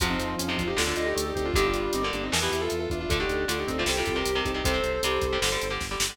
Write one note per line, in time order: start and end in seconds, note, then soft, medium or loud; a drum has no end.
0.00 0.15 F2 loud
0.00 0.32 C3 medium
0.00 0.63 F3 medium
0.00 0.32 F3 medium
0.00 0.10 F#4 loud
0.00 0.77 C5 medium
0.00 0.77 F5 medium
0.00 kick loud
0.00 closed hi-hat loud
0.10 0.35 C4 loud
0.10 0.35 D#4 loud
0.19 0.36 F2 loud
0.19 closed hi-hat medium
0.38 0.56 F2 medium
0.38 0.47 C#4 loud
0.38 closed hi-hat loud
0.48 0.72 C3 medium
0.48 0.72 F3 medium
0.48 0.57 C4 loud
0.48 0.57 D#4 loud
0.58 0.74 F2 medium
0.58 0.67 D4 medium
0.58 0.67 F4 loud
0.58 kick medium
0.58 closed hi-hat medium
0.67 0.76 D#4 loud
0.67 0.76 G4 loud
0.77 0.94 D2 loud
0.77 0.84 A2 medium
0.77 0.84 D3 medium
0.77 0.96 D4 medium
0.77 0.87 F4 medium
0.77 1.54 A4 medium
0.77 0.87 A4 loud
0.77 1.54 D5 medium
0.77 snare loud
0.86 1.17 A2 medium
0.86 1.17 D3 medium
0.86 0.97 D4 medium
0.86 0.97 F4 loud
0.96 1.14 D2 medium
0.96 1.06 D4 medium
0.96 1.14 D#4 loud
0.96 1.06 F4 loud
0.96 closed hi-hat medium
1.06 1.24 D#4 medium
1.06 1.24 G4 loud
1.15 1.33 D2 loud
1.15 1.31 A3 medium
1.15 closed hi-hat loud
1.25 1.34 D#4 medium
1.25 1.34 G4 medium
1.35 1.51 D2 loud
1.35 1.52 C4 medium
1.35 1.45 D#4 loud
1.35 1.45 G4 loud
1.35 kick medium
1.35 closed hi-hat medium
1.45 1.54 D4 loud
1.45 1.54 F4 loud
1.54 1.72 G1 loud
1.54 1.86 G2 medium
1.54 1.86 D3 medium
1.54 2.11 G3 loud
1.54 1.64 D#4 loud
1.54 2.31 G4 medium
1.54 1.64 G4 loud
1.54 2.31 D5 medium
1.54 kick loud
1.54 closed hi-hat loud
1.65 1.93 D4 medium
1.65 1.93 F4 loud
1.74 1.90 G1 medium
1.74 closed hi-hat medium
1.93 2.11 G1 loud
1.93 2.02 C4 loud
1.93 2.02 D#4 loud
1.93 closed hi-hat loud
2.03 2.27 G2 medium
2.03 2.27 D3 medium
2.03 2.12 A#4 medium
2.03 2.12 D5 loud
2.13 2.30 G1 loud
2.13 2.23 A#3 medium
2.13 2.23 D4 loud
2.13 closed hi-hat medium
2.23 2.32 C4 medium
2.23 2.32 D#4 loud
2.32 2.49 E2 loud
2.32 2.40 B2 medium
2.32 2.40 E3 medium
2.32 2.51 B3 medium
2.32 2.42 A#4 loud
2.32 3.09 B4 medium
2.32 3.09 E5 medium
2.32 snare loud
2.42 2.73 B2 medium
2.42 2.73 E3 medium
2.42 2.51 E4 medium
2.42 2.51 G4 loud
2.51 2.68 E2 loud
2.51 2.60 E4 loud
2.51 2.60 G4 loud
2.51 closed hi-hat medium
2.61 2.79 F4 loud
2.61 2.79 A4 loud
2.70 2.88 E2 loud
2.70 closed hi-hat medium
2.80 2.89 F4 medium
2.80 2.89 A4 loud
2.90 3.06 E2 loud
2.90 3.00 D4 medium
2.90 3.00 F4 medium
2.90 kick medium
2.90 closed hi-hat medium
3.00 3.09 D4 medium
3.00 3.09 F4 loud
3.09 3.25 D2 loud
3.09 3.19 D3 medium
3.09 3.19 A3 medium
3.09 3.86 D4 medium
3.09 3.59 D4 loud
3.09 3.18 F4 loud
3.09 3.18 A4 loud
3.09 3.86 A4 medium
3.09 kick loud
3.09 closed hi-hat loud
3.20 3.43 D3 medium
3.20 3.43 A3 medium
3.20 3.44 D#4 loud
3.20 3.44 G4 loud
3.29 3.46 D2 loud
3.29 closed hi-hat medium
3.48 3.65 D2 medium
3.48 3.71 D3 medium
3.48 3.71 A3 medium
3.48 3.57 D4 medium
3.48 3.57 F4 medium
3.48 closed hi-hat loud
3.59 3.68 D#4 medium
3.59 3.68 G4 loud
3.67 3.84 D2 medium
3.67 3.83 C4 medium
3.67 3.77 C4 medium
3.67 3.77 D#4 loud
3.67 kick medium
3.67 closed hi-hat medium
3.78 3.87 D3 medium
3.78 3.87 A3 medium
3.78 3.87 D4 medium
3.78 3.87 F4 loud
3.86 4.03 C2 loud
3.86 3.95 C3 medium
3.86 3.95 G3 medium
3.86 4.64 C4 medium
3.86 4.41 G4 medium
3.86 4.64 G4 medium
3.86 3.97 A4 medium
3.86 3.97 C5 loud
3.86 snare loud
3.97 4.13 C3 medium
3.97 4.13 G3 medium
3.97 4.06 F4 medium
3.97 4.06 A4 medium
4.06 4.23 C2 loud
4.06 4.16 F4 loud
4.06 4.16 A4 loud
4.06 kick medium
4.06 closed hi-hat medium
4.16 4.31 C3 medium
4.16 4.31 G3 medium
4.16 4.33 G4 medium
4.16 4.33 A#4 loud
4.25 4.42 C2 loud
4.25 closed hi-hat loud
4.35 4.51 C3 medium
4.35 4.51 G3 medium
4.35 4.44 G4 medium
4.35 4.44 A#4 loud
4.45 4.62 C2 loud
4.45 4.54 D#4 medium
4.45 4.54 G4 loud
4.45 4.54 A4 medium
4.45 kick medium
4.45 closed hi-hat medium
4.54 4.62 C3 medium
4.54 4.62 G3 medium
4.54 4.64 D#4 loud
4.54 4.64 G4 loud
4.64 4.80 C2 loud
4.64 4.73 C3 medium
4.64 4.73 G3 medium
4.64 5.01 C4 loud
4.64 5.72 A4 medium
4.64 5.72 C5 loud
4.64 kick loud
4.64 closed hi-hat loud
4.74 4.97 C3 medium
4.74 4.97 G3 medium
4.84 5.00 C2 loud
4.84 closed hi-hat medium
5.03 5.19 C2 loud
5.03 5.27 C3 medium
5.03 5.27 G3 medium
5.03 5.39 G3 medium
5.03 closed hi-hat loud
5.21 5.38 C2 loud
5.21 kick medium
5.21 closed hi-hat medium
5.33 5.40 C3 medium
5.33 5.40 G3 medium
5.42 5.58 G1 loud
5.42 5.50 D3 medium
5.42 5.50 G3 medium
5.42 snare loud
5.52 5.67 D3 medium
5.52 5.67 G3 medium
5.61 5.79 G1 loud
5.61 closed hi-hat medium
5.70 5.86 D3 medium
5.70 5.86 G3 medium
5.81 5.97 G1 loud
5.81 kick medium
5.81 snare medium
5.91 6.06 D3 medium
5.91 6.06 G3 medium
6.00 6.17 G1 loud
6.00 snare loud
6.09 6.17 D3 medium
6.09 6.17 G3 medium